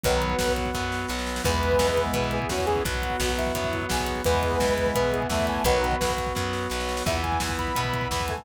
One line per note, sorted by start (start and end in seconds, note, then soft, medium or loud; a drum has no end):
0.04 0.36 B1 loud
0.04 0.34 D#3 medium
0.04 0.34 F#3 medium
0.04 0.36 F#3 loud
0.04 1.43 B3 medium
0.04 1.42 B3 medium
0.04 0.36 B3 medium
0.04 1.43 F#4 medium
0.04 1.42 F#4 medium
0.04 0.53 B4 loud
0.04 kick loud
0.04 closed hi-hat loud
0.12 kick medium
0.22 kick medium
0.22 closed hi-hat medium
0.30 kick medium
0.38 0.72 B1 medium
0.38 0.70 F#3 medium
0.38 0.70 B3 medium
0.38 kick medium
0.38 snare loud
0.48 kick medium
0.56 kick medium
0.56 closed hi-hat medium
0.65 kick medium
0.74 1.06 F#2 medium
0.74 1.06 F#3 medium
0.74 1.06 B3 medium
0.74 kick medium
0.74 snare medium
0.92 snare medium
1.08 1.41 B1 medium
1.08 1.41 F#3 medium
1.08 1.41 B3 medium
1.08 snare medium
1.19 snare medium
1.26 snare medium
1.36 snare loud
1.44 1.77 E2 loud
1.44 1.75 E3 loud
1.44 2.39 G#3 medium
1.44 2.83 B3 medium
1.44 2.82 B3 loud
1.44 2.39 B3 medium
1.44 1.75 B3 loud
1.44 2.83 E4 medium
1.44 2.82 E4 medium
1.44 2.05 B4 loud
1.44 kick loud
1.44 crash loud
1.54 kick medium
1.62 kick medium
1.62 closed hi-hat medium
1.72 kick medium
1.79 2.11 E2 medium
1.79 2.11 E3 medium
1.79 2.11 B3 medium
1.79 kick medium
1.79 snare loud
1.88 kick medium
1.97 kick medium
1.97 closed hi-hat medium
2.06 kick medium
2.13 2.45 B2 medium
2.13 2.46 E3 medium
2.13 2.46 B3 medium
2.13 2.32 B4 medium
2.13 kick loud
2.13 closed hi-hat loud
2.24 kick medium
2.31 2.50 G#4 medium
2.31 kick medium
2.31 closed hi-hat medium
2.42 kick medium
2.49 2.81 E2 medium
2.49 2.82 E3 medium
2.49 2.82 B3 medium
2.49 2.82 C#4 medium
2.49 2.66 F#4 medium
2.49 kick medium
2.49 snare loud
2.58 kick medium
2.66 2.84 G#4 loud
2.66 kick medium
2.66 closed hi-hat medium
2.76 kick medium
2.85 3.17 B1 medium
2.85 3.16 F#3 loud
2.85 4.23 B3 medium
2.85 4.24 B3 medium
2.85 3.16 B3 medium
2.85 3.32 F#4 medium
2.85 4.23 F#4 loud
2.85 4.25 F#4 medium
2.85 kick loud
2.85 closed hi-hat loud
2.94 kick medium
3.02 kick medium
3.02 closed hi-hat medium
3.10 kick medium
3.20 3.52 B1 medium
3.20 3.52 F#3 medium
3.20 3.52 B3 medium
3.20 kick medium
3.20 snare loud
3.29 kick medium
3.37 3.85 E4 medium
3.37 kick medium
3.37 closed hi-hat medium
3.46 kick medium
3.55 3.86 F#2 medium
3.55 3.86 F#3 medium
3.55 3.86 B3 medium
3.55 kick medium
3.55 closed hi-hat loud
3.64 kick medium
3.73 kick medium
3.73 closed hi-hat medium
3.82 kick medium
3.89 4.23 B1 medium
3.89 4.21 F#3 medium
3.89 4.21 B3 medium
3.89 4.22 G#4 medium
3.89 kick medium
3.89 snare loud
3.99 kick medium
4.07 kick medium
4.07 closed hi-hat medium
4.16 kick medium
4.24 4.57 E2 medium
4.24 4.57 E3 medium
4.24 5.23 G#3 medium
4.24 5.64 B3 medium
4.24 5.63 B3 medium
4.24 5.23 B3 medium
4.24 4.57 B3 loud
4.24 5.64 E4 medium
4.24 5.63 E4 medium
4.24 4.90 B4 loud
4.24 kick loud
4.24 closed hi-hat loud
4.34 kick medium
4.42 kick medium
4.42 closed hi-hat medium
4.52 kick medium
4.60 4.92 E2 medium
4.60 4.92 E3 medium
4.60 4.92 B3 medium
4.60 kick medium
4.60 snare loud
4.68 kick medium
4.77 kick medium
4.77 closed hi-hat medium
4.86 kick medium
4.94 5.27 B2 medium
4.94 5.27 E3 medium
4.94 5.27 B3 medium
4.94 5.11 B4 medium
4.94 kick loud
4.94 closed hi-hat loud
5.04 kick medium
5.12 5.27 G#4 loud
5.12 kick medium
5.12 closed hi-hat medium
5.22 kick medium
5.29 5.61 E2 medium
5.29 5.61 E3 medium
5.29 5.64 A3 loud
5.29 5.61 B3 medium
5.29 5.46 E5 medium
5.29 kick loud
5.29 snare loud
5.39 kick medium
5.47 5.63 G#5 medium
5.47 kick medium
5.47 closed hi-hat medium
5.56 kick medium
5.64 5.96 B1 loud
5.64 5.95 D#3 medium
5.64 5.97 F#3 loud
5.64 5.95 F#3 medium
5.64 7.03 B3 medium
5.64 7.05 B3 medium
5.64 5.97 B3 medium
5.64 7.03 F#4 medium
5.64 7.05 F#4 medium
5.64 6.13 B4 loud
5.64 kick loud
5.64 closed hi-hat loud
5.74 kick medium
5.83 kick medium
5.83 closed hi-hat medium
5.91 kick medium
6.01 6.32 B1 medium
6.01 6.32 F#3 medium
6.01 6.32 B3 medium
6.01 kick medium
6.01 snare loud
6.09 kick medium
6.17 kick medium
6.17 closed hi-hat medium
6.27 kick medium
6.35 6.68 F#2 medium
6.35 6.67 F#3 medium
6.35 6.67 B3 medium
6.35 kick medium
6.35 snare medium
6.53 snare medium
6.70 7.03 B1 medium
6.70 7.03 F#3 medium
6.70 7.03 B3 medium
6.70 snare medium
6.80 snare medium
6.89 snare medium
6.97 snare loud
7.06 7.38 E2 medium
7.06 7.38 E3 loud
7.06 8.45 B3 medium
7.06 8.43 B3 loud
7.06 7.38 B3 medium
7.06 8.45 E4 medium
7.06 8.43 E4 loud
7.06 7.21 E5 loud
7.06 kick loud
7.06 crash loud
7.15 kick medium
7.23 7.55 G#5 medium
7.23 kick medium
7.23 closed hi-hat medium
7.32 kick medium
7.40 7.73 E2 medium
7.40 7.72 E3 medium
7.40 7.72 B3 medium
7.40 kick medium
7.40 snare loud
7.49 kick loud
7.58 8.09 B5 loud
7.58 kick medium
7.58 closed hi-hat medium
7.67 kick medium
7.75 8.08 B2 medium
7.75 8.07 E3 medium
7.75 8.07 B3 medium
7.75 kick medium
7.75 closed hi-hat loud
7.84 kick medium
7.93 kick medium
7.93 closed hi-hat medium
8.01 kick medium
8.10 8.43 E2 medium
8.10 8.43 E3 medium
8.10 8.43 B3 medium
8.10 8.26 B5 medium
8.10 kick loud
8.10 snare loud
8.20 kick medium
8.28 8.43 A3 medium
8.28 8.44 G#5 loud
8.28 kick medium
8.28 closed hi-hat medium
8.38 kick loud